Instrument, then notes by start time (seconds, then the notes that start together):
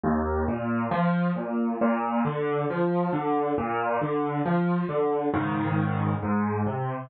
acoustic grand piano
0.03 D#2
0.48 A#2
0.91 F3
1.36 A#2
1.81 A#2
2.25 D3
2.70 F3
3.13 D3
3.58 A#2
4.02 D3
4.46 F3
4.89 D3
5.34 G#2 C#3 D#3
6.23 G#2
6.66 C3